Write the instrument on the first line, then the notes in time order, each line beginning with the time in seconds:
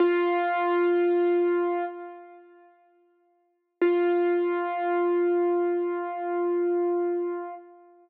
acoustic grand piano
0.00 F4
3.82 F4